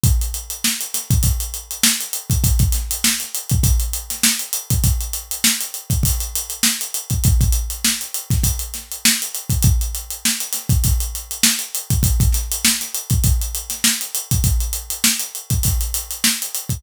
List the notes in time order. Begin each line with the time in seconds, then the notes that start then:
0.04 kick, closed hi-hat
0.21 closed hi-hat
0.34 closed hi-hat
0.50 closed hi-hat
0.64 snare
0.81 closed hi-hat
0.94 snare, closed hi-hat
1.10 kick, closed hi-hat
1.23 kick, closed hi-hat
1.40 closed hi-hat
1.54 closed hi-hat
1.71 closed hi-hat
1.83 snare
2.00 closed hi-hat
2.13 closed hi-hat
2.30 kick, closed hi-hat
2.44 kick, closed hi-hat
2.59 kick, closed hi-hat
2.72 snare, closed hi-hat
2.91 closed hi-hat
3.04 snare
3.20 snare, closed hi-hat
3.35 closed hi-hat
3.50 kick, closed hi-hat
3.63 kick, closed hi-hat
3.80 closed hi-hat
3.93 closed hi-hat
4.10 snare, closed hi-hat
4.23 snare
4.39 closed hi-hat
4.53 closed hi-hat
4.70 kick, closed hi-hat
4.84 kick, closed hi-hat
5.00 closed hi-hat
5.13 closed hi-hat
5.31 closed hi-hat
5.44 snare
5.61 closed hi-hat
5.74 closed hi-hat
5.90 kick, closed hi-hat
6.03 kick, closed hi-hat
6.20 closed hi-hat
6.35 closed hi-hat
6.50 closed hi-hat
6.63 snare
6.81 closed hi-hat
6.94 closed hi-hat
7.10 kick, closed hi-hat
7.24 kick, closed hi-hat
7.41 kick, closed hi-hat
7.52 closed hi-hat
7.70 closed hi-hat
7.84 snare
8.01 closed hi-hat
8.14 closed hi-hat
8.30 kick, snare, closed hi-hat
8.44 kick, closed hi-hat
8.59 closed hi-hat
8.74 snare, closed hi-hat
8.92 closed hi-hat
9.05 snare
9.22 closed hi-hat
9.35 closed hi-hat
9.50 kick, closed hi-hat
9.62 kick, closed hi-hat
9.81 closed hi-hat
9.95 closed hi-hat
10.10 closed hi-hat
10.25 snare
10.40 closed hi-hat
10.53 snare, closed hi-hat
10.69 kick, closed hi-hat
10.84 kick, closed hi-hat
11.00 closed hi-hat
11.15 closed hi-hat
11.31 closed hi-hat
11.43 snare
11.59 closed hi-hat
11.75 closed hi-hat
11.90 kick, closed hi-hat
12.03 kick, closed hi-hat
12.20 kick, closed hi-hat
12.32 snare, closed hi-hat
12.52 closed hi-hat
12.64 snare
12.81 snare, closed hi-hat
12.95 closed hi-hat
13.10 kick, closed hi-hat
13.24 kick, closed hi-hat
13.42 closed hi-hat
13.55 closed hi-hat
13.70 snare, closed hi-hat
13.84 snare
14.01 closed hi-hat
14.15 closed hi-hat
14.31 kick, closed hi-hat
14.44 kick, closed hi-hat
14.60 closed hi-hat
14.73 closed hi-hat
14.90 closed hi-hat
15.04 snare
15.20 closed hi-hat
15.35 closed hi-hat
15.50 kick, closed hi-hat
15.63 kick, closed hi-hat
15.81 closed hi-hat
15.94 closed hi-hat
16.11 closed hi-hat
16.24 snare
16.42 closed hi-hat
16.55 closed hi-hat
16.69 kick, closed hi-hat